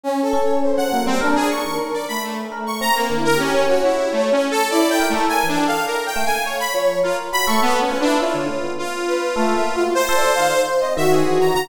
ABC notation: X:1
M:6/4
L:1/16
Q:1/4=103
K:none
V:1 name="Lead 2 (sawtooth)"
z5 ^f2 C | z ^G ^c'2 z d b A, z2 c' ^a ^A,2 ^A ^C2 ^F E2 (3=A,2 C2 =A2 | (3d2 g2 A,2 (3^g2 D2 f2 (3^A2 =g2 ^g2 ^c b z2 F z b ^c' (3B,2 ^C2 D2 | F4 F8 c5 z2 e ^G2 ^a a |]
V:2 name="Brass Section"
(3^C2 A2 ^c2 =c2 ^A,2 | D3 ^A3 =A,6 (3^A2 E2 G2 ^c6 z2 | (3E4 ^A4 =A4 z2 f4 ^c2 z3 A, z2 B2 | ^c2 z4 B2 (3A,2 e2 F2 (3=c2 d2 f2 c2 ^d ^F5 |]
V:3 name="Electric Piano 1"
z2 ^C3 ^C, ^F, G, | ^A z2 ^D, z5 A z C2 =D,2 A ^C2 ^F z5 | z2 ^A =A z E, G z3 A, z3 F,2 ^A2 ^F =A2 B, =F E | E D, A, B,2 z3 (3A2 ^A,2 ^F2 z =A z ^D, z2 C D,2 E,2 =D, |]